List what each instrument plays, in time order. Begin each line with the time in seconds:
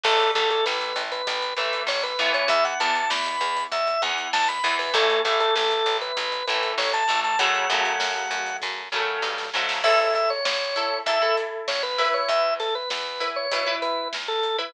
0.04 electric bass (finger) A1, overdriven guitar E3 A3, drawbar organ A4, kick, crash
0.20 closed hi-hat
0.35 electric bass (finger) A1, overdriven guitar E3 A3, drawbar organ A4, kick, snare, closed hi-hat
0.50 drawbar organ A4, closed hi-hat
0.66 electric bass (finger) A1, drawbar organ B4, snare
0.81 closed hi-hat
0.96 electric bass (finger) A1, closed hi-hat
1.12 drawbar organ B4, closed hi-hat
1.27 electric bass (finger) A1, kick, closed hi-hat
1.42 closed hi-hat
1.57 electric bass (finger) A1, overdriven guitar E3 A3, drawbar organ B4, closed hi-hat
1.73 closed hi-hat
1.87 electric bass (finger) A1, drawbar organ C#5, snare
2.03 drawbar organ B4, closed hi-hat
2.19 electric bass (finger) A1, overdriven guitar E3 B3, closed hi-hat
2.34 drawbar organ C#5, closed hi-hat
2.48 electric bass (finger) E2, drawbar organ E5, kick, closed hi-hat
2.65 drawbar organ F#5, closed hi-hat
2.80 electric bass (finger) E2, overdriven guitar E3 B3, drawbar organ A5, snare, closed hi-hat
2.95 drawbar organ A5, closed hi-hat
3.10 electric bass (finger) E2, drawbar organ B5, snare
3.26 closed hi-hat
3.41 electric bass (finger) E2, closed hi-hat
3.57 closed hi-hat
3.72 electric bass (finger) E2, drawbar organ E5, kick, closed hi-hat
3.87 closed hi-hat
4.02 electric bass (finger) E2, overdriven guitar E3 B3, drawbar organ F#5, closed hi-hat
4.18 closed hi-hat
4.33 electric bass (finger) E2, drawbar organ A5, snare
4.48 drawbar organ B5, closed hi-hat
4.64 electric bass (finger) E2, overdriven guitar E3 B3, closed hi-hat
4.79 drawbar organ B4, open hi-hat
4.94 electric bass (finger) A1, overdriven guitar E3 A3, drawbar organ A4, kick, closed hi-hat
5.10 closed hi-hat
5.25 electric bass (finger) A1, overdriven guitar E3 A3, drawbar organ A4, kick, snare, closed hi-hat
5.40 drawbar organ A4, closed hi-hat
5.56 electric bass (finger) A1, drawbar organ A4, snare
5.71 closed hi-hat
5.86 electric bass (finger) A1, closed hi-hat
6.01 drawbar organ B4, closed hi-hat
6.17 electric bass (finger) A1, kick, closed hi-hat
6.32 closed hi-hat
6.47 electric bass (finger) A1, overdriven guitar E3 A3, drawbar organ B4, closed hi-hat
6.63 closed hi-hat
6.78 electric bass (finger) A1, drawbar organ C#5, snare
6.93 drawbar organ A5, closed hi-hat
7.08 electric bass (finger) A1, overdriven guitar E3 A3, closed hi-hat
7.24 drawbar organ A5, closed hi-hat
7.39 electric bass (finger) F#2, overdriven guitar C#3 F#3 A3, drawbar organ F#5, kick, closed hi-hat
7.55 closed hi-hat
7.70 electric bass (finger) F#2, overdriven guitar C#3 F#3 A3, snare, closed hi-hat
7.85 closed hi-hat
8.00 electric bass (finger) F#2, snare
8.31 electric bass (finger) F#2, closed hi-hat
8.46 closed hi-hat
8.62 electric bass (finger) F#2, kick, snare
8.92 electric bass (finger) F#2, overdriven guitar C#3 F#3 A3, snare
9.22 electric bass (finger) G2, snare
9.38 snare
9.54 electric bass (finger) G#2, overdriven guitar C#3 F#3 A3, snare
9.69 snare
9.84 electric bass (finger) A1, overdriven guitar E4 A4, drawbar organ E5, kick, crash
9.99 drawbar organ E5
10.15 drawbar organ E5, kick, snare, closed hi-hat
10.30 drawbar organ C#5
10.45 electric bass (finger) A1, drawbar organ C#5, snare
10.76 overdriven guitar E4 A4, closed hi-hat
11.06 electric bass (finger) E2, overdriven guitar E4 A4, drawbar organ E5, kick, closed hi-hat
11.22 overdriven guitar E4 A4
11.37 closed hi-hat
11.68 electric bass (finger) A1, drawbar organ C#5, snare
11.83 drawbar organ B4
11.98 overdriven guitar E4 B4, open hi-hat
12.14 drawbar organ C#5
12.29 electric bass (finger) E2, drawbar organ E5, kick, closed hi-hat
12.60 drawbar organ A4, snare, closed hi-hat
12.75 drawbar organ B4
12.90 electric bass (finger) E2, drawbar organ B4, snare
13.20 overdriven guitar E4 B4, closed hi-hat
13.36 drawbar organ C#5
13.52 electric bass (finger) B2, overdriven guitar E4 B4, kick, closed hi-hat
13.67 overdriven guitar E4 B4
13.82 drawbar organ B4, closed hi-hat
14.13 electric bass (finger) E2, snare
14.28 drawbar organ A4
14.43 closed hi-hat
14.59 overdriven guitar E4 B4, drawbar organ B4